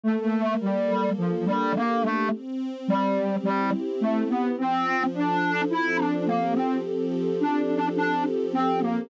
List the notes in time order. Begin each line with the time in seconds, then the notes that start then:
0.04 A3 A#3
0.61 G3 A4
1.17 F3 D4
1.46 G3
1.74 A#3 G4
2.02 A3
2.30 C4
2.87 G3 G4
3.43 G3 E4
4.01 A3 G4
4.29 B3
4.57 F3 C4
5.14 D4 A4
5.70 C4 E4
5.97 D4
6.26 A#3 G4
6.55 C4
6.83 F3
7.40 D4 A4
7.96 D4 G4
8.53 C4
8.81 A#3